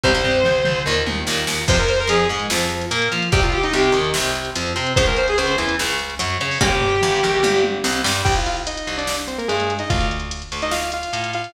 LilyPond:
<<
  \new Staff \with { instrumentName = "Distortion Guitar" } { \time 4/4 \key f \minor \tempo 4 = 146 c''2 r2 | c''16 bes'16 c''16 bes'16 aes'8 r2 r8 | g'16 f'16 g'16 ees'16 g'8 r2 r8 | c''16 bes'16 c''16 aes'16 c''8 r2 r8 |
g'2~ g'8 r4. | \key c \minor r1 | r1 | }
  \new Staff \with { instrumentName = "Lead 2 (sawtooth)" } { \time 4/4 \key f \minor r1 | r1 | r1 | r1 |
r1 | \key c \minor <g' g''>16 <f' f''>16 <f' f''>16 r16 <ees' ees''>8. <d' d''>8 r16 <c' c''>16 <bes bes'>16 <aes aes'>8. <ees' ees''>16 | <f' f''>8 r4 r16 <ees' ees''>16 <f' f''>8 <f' f''>4 <f' f''>8 | }
  \new Staff \with { instrumentName = "Overdriven Guitar" } { \time 4/4 \key f \minor <c g>16 <c g>4.~ <c g>16 <bes, ees>4 <bes, ees>4 | <c f>8 r8 f8 aes8 f4 bes8 f'8 | <c g>8 r8 c8 ees8 c4 f8 c'8 | <des f aes>8 r8 des8 e8 des4 ges8 des'8 |
<des g bes>8 r8 g,8 bes,8 g,4 c8 g8 | \key c \minor r1 | r1 | }
  \new Staff \with { instrumentName = "Electric Bass (finger)" } { \clef bass \time 4/4 \key f \minor c,8 c,8 c,8 c,8 ees,8 ees,8 ees,8 ees,8 | f,4 f,8 aes,8 f,4 bes,8 f8 | c,4 c,8 ees,8 c,4 f,8 c8 | des,4 des,8 e,8 des,4 ges,8 des8 |
g,,4 g,,8 bes,,8 g,,4 c,8 g,8 | \key c \minor c,4. c,4. g,4 | d,4. d,4. a,4 | }
  \new DrumStaff \with { instrumentName = "Drums" } \drummode { \time 4/4 <bd tomfh>8 tomfh8 toml8 toml8 r8 tommh8 sn8 sn8 | <cymc bd>16 hh16 hh16 hh16 hh16 hh16 hh16 hh16 sn16 hh16 hh16 hh16 hh16 hh16 hh16 hh16 | <hh bd>16 hh16 hh16 hh16 hh16 hh16 hh16 hh16 sn16 hh16 hh16 hh16 hh16 hh16 hh16 hh16 | <hh bd>16 hh16 hh16 hh16 hh16 hh16 hh16 hh16 sn16 hh16 hh16 hh16 hh16 hh16 hh16 hho16 |
<bd tomfh>8 tomfh8 toml8 toml8 tommh8 tommh8 sn8 sn8 | <cymc bd>16 hh16 hh16 hh16 hh16 hh16 hh16 hh16 sn16 hh16 hh16 hh16 hh16 hh16 hh16 hh16 | <hh bd>16 hh16 hh16 hh16 hh16 hh16 hh16 hh16 sn16 hh16 hh16 hh16 hh16 hh16 hh16 hh16 | }
>>